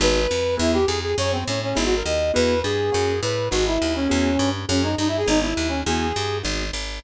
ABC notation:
X:1
M:4/4
L:1/8
Q:1/4=205
K:G#m
V:1 name="Brass Section"
B4 E =G ^G G | c ^B, C C (3E F A d2 | B2 G4 B2 | F E2 C4 z |
C D (3D E G D E2 C | G4 z4 |]
V:2 name="Acoustic Grand Piano"
[B,DFG]4 [B,EFG]4 | [A,CFG]4 [B,DFG]4 | [B,EFG]4 [A,CFG]4 | [B,DFG]4 [B,EFG]4 |
[A,CFG]4 [B,DFG]4 | [B,EFG]4 [B,DFG]4 |]
V:3 name="Electric Bass (finger)" clef=bass
G,,,2 ^E,,2 =E,,2 ^E,,2 | F,,2 =A,,2 G,,,2 D,,2 | E,,2 =G,,2 F,,2 =A,,2 | G,,,2 D,,2 E,,2 =G,,2 |
F,,2 =G,,2 ^G,,,2 D,,2 | E,,2 =G,,2 ^G,,,2 G,,,2 |]